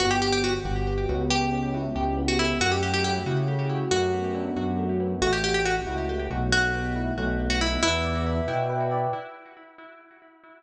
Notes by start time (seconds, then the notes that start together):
0.00 G1 B3 F#4
0.11 G4
0.22 G4
0.32 G4
0.43 B3 F#4
0.65 G1 F#4
0.87 B3
1.09 C#2 B3
1.30 G4
1.52 C#4
1.74 E4
1.95 C#2 G4
2.17 B3
2.28 F#4
2.39 A3 E4
2.60 F#2 F#4
2.72 G4
2.83 F#4 G4
2.94 G4
3.04 A3 G4
3.26 C#3 E4
3.48 A3
3.69 F#4
3.91 F#2 A3 F#4
4.13 B3
4.35 D4
4.56 F#2 F#4
4.78 A3
5.00 B3
5.22 A1 A3 F#4
5.33 G4
5.43 F#4 G4
5.54 G4
5.65 A3 F#4
5.87 C#2 E4
6.09 A3
6.30 B1 F#4
6.52 A3 F#4
6.74 B3
6.95 E4
7.17 B1 A3
7.39 B3
7.50 F#4
7.61 D#4 E4
7.83 E2 E4 B4
8.04 D5
8.26 E5
8.48 B2 G5
8.69 B4
8.91 D5